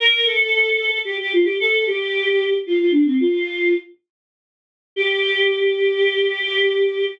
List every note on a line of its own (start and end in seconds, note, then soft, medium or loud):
0.00 0.26 A#4 medium
0.24 0.98 A4 medium
1.05 1.17 G4 medium
1.20 1.33 G4 medium
1.33 1.46 F4 medium
1.44 1.57 G4 medium
1.60 1.84 A4 medium
1.86 2.53 G4 medium
2.66 2.79 F4 medium
2.79 2.92 F4 medium
2.91 3.04 D4 medium
3.05 3.17 C4 medium
3.20 3.73 F4 medium
4.96 7.04 G4 loud